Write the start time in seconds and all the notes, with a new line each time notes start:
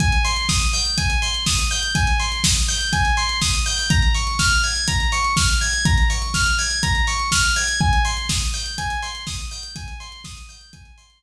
0.00 G#5, kick, closed hi-hat
0.12 closed hi-hat
0.24 C6, open hi-hat
0.36 closed hi-hat
0.49 D#6, kick, snare
0.61 closed hi-hat
0.73 G6, open hi-hat
0.85 closed hi-hat
0.98 G#5, kick, closed hi-hat
1.10 closed hi-hat
1.22 C6, open hi-hat
1.34 closed hi-hat
1.46 D#6, kick, snare
1.58 closed hi-hat
1.71 G6, open hi-hat
1.83 closed hi-hat
1.95 G#5, kick, closed hi-hat
2.07 closed hi-hat
2.20 C6, open hi-hat
2.32 closed hi-hat
2.44 D#6, kick, snare
2.56 closed hi-hat
2.68 G6, open hi-hat
2.81 closed hi-hat
2.93 G#5, kick, closed hi-hat
3.05 closed hi-hat
3.17 C6, open hi-hat
3.29 closed hi-hat
3.41 D#6, kick, snare
3.54 closed hi-hat
3.66 G6, open hi-hat
3.78 open hi-hat
3.90 A#5, kick, closed hi-hat
4.02 closed hi-hat
4.14 C#6, open hi-hat
4.27 closed hi-hat
4.39 F6, kick, snare
4.51 closed hi-hat
4.63 G#6, open hi-hat
4.76 closed hi-hat
4.88 A#5, kick, closed hi-hat
5.00 closed hi-hat
5.12 C#6, open hi-hat
5.24 closed hi-hat
5.37 F6, kick, snare
5.49 closed hi-hat
5.61 G#6, open hi-hat
5.73 closed hi-hat
5.85 A#5, kick, closed hi-hat
5.98 closed hi-hat
6.10 C#6, open hi-hat
6.22 closed hi-hat
6.34 F6, kick, snare
6.46 closed hi-hat
6.59 G#6, open hi-hat
6.71 closed hi-hat
6.83 A#5, kick, closed hi-hat
6.95 closed hi-hat
7.07 C#6, open hi-hat
7.19 closed hi-hat
7.32 F6, kick, snare
7.44 closed hi-hat
7.56 G#6, open hi-hat
7.68 closed hi-hat
7.80 G#5, kick
7.93 closed hi-hat
8.05 C6, open hi-hat
8.17 closed hi-hat
8.29 D#6, kick, snare
8.41 closed hi-hat
8.54 G6, open hi-hat
8.66 closed hi-hat
8.78 G#5, kick, closed hi-hat
8.90 closed hi-hat
9.02 C6, open hi-hat
9.15 closed hi-hat
9.27 D#6, kick, snare
9.39 closed hi-hat
9.51 G6, open hi-hat
9.63 closed hi-hat
9.76 G#5, kick, closed hi-hat
9.88 closed hi-hat
10.00 C6, open hi-hat
10.12 closed hi-hat
10.24 D#6, kick, snare
10.37 closed hi-hat
10.49 G6, open hi-hat
10.61 closed hi-hat
10.73 G#5, kick, closed hi-hat
10.85 closed hi-hat
10.98 C6, open hi-hat
11.10 closed hi-hat